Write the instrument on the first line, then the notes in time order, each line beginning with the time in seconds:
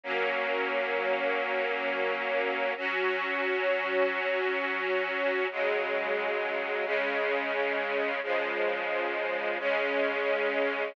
string ensemble 1
0.03 F#3 A#3 C#4
2.77 F#3 C#4 F#4
5.51 C#3 F#3 G#3
6.85 C#3 G#3 C#4
8.23 C#3 F3 G#3
9.59 C#3 G#3 C#4